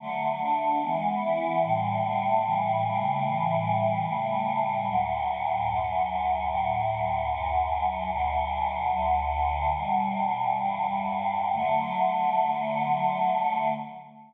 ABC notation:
X:1
M:2/2
L:1/8
Q:1/2=74
K:D
V:1 name="Choir Aahs"
[D,F,A,]2 [D,A,D]2 [E,^G,B,]2 [E,B,E]2 | [A,,D,E,G,]2 [A,,D,G,A,]2 [A,,C,E,G,]2 [A,,C,G,A,]2 | [A,,C,E,G,]4 [A,,C,G,A,]4 | [D,,A,,F,]4 [D,,F,,F,]4 |
[D,,A,,F,]4 [D,,F,,F,]4 | [D,,B,,F,]4 [D,,D,F,]4 | "^rit." [E,,B,,G,]4 [E,,G,,G,]4 | [D,F,A,]8 |]